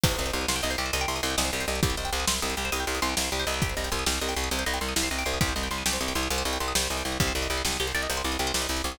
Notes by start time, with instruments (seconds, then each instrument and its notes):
0.04 electric bass (finger) C2, pizzicato strings G4, kick, crash
0.11 pizzicato strings C5
0.18 electric bass (finger) C2, pizzicato strings D#5
0.26 pizzicato strings G5, closed hi-hat
0.33 electric bass (finger) C2, pizzicato strings C6
0.41 pizzicato strings D#6
0.48 electric bass (finger) C2, pizzicato strings C6, snare
0.56 pizzicato strings G5
0.63 electric bass (finger) C2, pizzicato strings D#5
0.70 pizzicato strings C5, closed hi-hat
0.78 electric bass (finger) C2, pizzicato strings G4
0.86 pizzicato strings C5
0.93 electric bass (finger) C2, pizzicato strings D#5, closed hi-hat
1.01 pizzicato strings G5
1.08 electric bass (finger) C2, pizzicato strings C6
1.16 pizzicato strings D#6, closed hi-hat
1.23 electric bass (finger) C2, pizzicato strings C6
1.30 pizzicato strings G5
1.38 electric bass (finger) C2, pizzicato strings D#5, snare
1.45 pizzicato strings C5
1.53 electric bass (finger) C2, pizzicato strings G4
1.60 pizzicato strings C5, closed hi-hat
1.68 electric bass (finger) C2, pizzicato strings D#5
1.75 pizzicato strings G5
1.83 electric bass (finger) C2, pizzicato strings G4, kick, closed hi-hat
1.90 pizzicato strings C5
1.97 electric bass (finger) C2, pizzicato strings D#5
2.05 pizzicato strings G5, closed hi-hat
2.13 electric bass (finger) C2, pizzicato strings C6
2.20 pizzicato strings D#6
2.27 electric bass (finger) C2, pizzicato strings C6, snare
2.35 pizzicato strings G5
2.42 electric bass (finger) C2, pizzicato strings D#5
2.50 pizzicato strings C5, closed hi-hat
2.57 electric bass (finger) C2, pizzicato strings G4
2.65 pizzicato strings C5
2.72 electric bass (finger) C2, pizzicato strings D#5, closed hi-hat
2.80 pizzicato strings G5
2.87 electric bass (finger) C2, pizzicato strings C6
2.95 pizzicato strings D#6, closed hi-hat
3.02 electric bass (finger) C2, pizzicato strings C6
3.09 pizzicato strings G5
3.17 electric bass (finger) C2, pizzicato strings D#5, snare
3.24 pizzicato strings C5
3.32 electric bass (finger) C2, pizzicato strings G4
3.39 pizzicato strings C5, closed hi-hat
3.47 electric bass (finger) C2, pizzicato strings D#5
3.54 pizzicato strings G5
3.62 pizzicato strings G4, kick, closed hi-hat
3.69 pizzicato strings C5
3.77 electric bass (finger) C2, pizzicato strings D#5
3.84 pizzicato strings G5, closed hi-hat
3.92 electric bass (finger) C2, pizzicato strings C6
3.99 pizzicato strings D#6
4.06 electric bass (finger) C2, pizzicato strings G4, snare
4.14 pizzicato strings C5
4.22 electric bass (finger) C2, pizzicato strings D#5
4.29 pizzicato strings G5, closed hi-hat
4.37 electric bass (finger) C2, pizzicato strings C6
4.44 pizzicato strings D#6
4.51 electric bass (finger) C2, pizzicato strings G4, closed hi-hat
4.59 pizzicato strings C5
4.66 electric bass (finger) C2, pizzicato strings D#5
4.74 pizzicato strings G5, closed hi-hat
4.81 electric bass (finger) C2, pizzicato strings C6
4.89 pizzicato strings D#6
4.96 electric bass (finger) C2, pizzicato strings G4, snare
5.03 pizzicato strings C5
5.11 electric bass (finger) C2, pizzicato strings D#5
5.19 pizzicato strings G5, closed hi-hat
5.26 electric bass (finger) C2, pizzicato strings C6
5.34 pizzicato strings D#6
5.41 electric bass (finger) C2, pizzicato strings G4, kick, closed hi-hat
5.49 pizzicato strings C5
5.56 electric bass (finger) C2, pizzicato strings D#5
5.63 pizzicato strings G5, closed hi-hat
5.71 electric bass (finger) C2, pizzicato strings C6
5.78 pizzicato strings D#6
5.86 electric bass (finger) C2, pizzicato strings G4, snare
5.93 pizzicato strings C5
6.01 electric bass (finger) C2, pizzicato strings D#5
6.08 pizzicato strings G5, closed hi-hat
6.15 electric bass (finger) C2, pizzicato strings C6
6.23 pizzicato strings D#6
6.30 electric bass (finger) C2, pizzicato strings G4, closed hi-hat
6.38 pizzicato strings C5
6.45 electric bass (finger) C2, pizzicato strings D#5
6.53 pizzicato strings G5, closed hi-hat
6.60 electric bass (finger) C2, pizzicato strings C6
6.68 pizzicato strings D#6
6.75 electric bass (finger) C2, pizzicato strings G4, snare
6.83 pizzicato strings C5
6.90 electric bass (finger) C2, pizzicato strings D#5
6.97 pizzicato strings G5, closed hi-hat
7.05 electric bass (finger) C2, pizzicato strings C6
7.12 pizzicato strings D#6
7.20 electric bass (finger) C2, pizzicato strings G4, kick, closed hi-hat
7.28 pizzicato strings C5
7.35 electric bass (finger) C2, pizzicato strings D5
7.42 pizzicato strings D#5, closed hi-hat
7.50 electric bass (finger) C2, pizzicato strings G5
7.58 pizzicato strings C6
7.65 electric bass (finger) C2, pizzicato strings D6, snare
7.72 pizzicato strings D#6
7.80 electric bass (finger) C2, pizzicato strings G4
7.87 pizzicato strings C5, closed hi-hat
7.95 electric bass (finger) C2, pizzicato strings D5
8.03 pizzicato strings D#5
8.10 electric bass (finger) C2, pizzicato strings G5, closed hi-hat
8.17 pizzicato strings C6
8.24 electric bass (finger) C2, pizzicato strings D6
8.32 pizzicato strings D#6, closed hi-hat
8.39 electric bass (finger) C2, pizzicato strings G4
8.47 pizzicato strings C5
8.54 electric bass (finger) C2, pizzicato strings D5, snare
8.62 pizzicato strings D#5
8.69 electric bass (finger) C2, pizzicato strings G5
8.77 pizzicato strings C6, closed hi-hat
8.84 electric bass (finger) C2, pizzicato strings D6
8.92 pizzicato strings D#6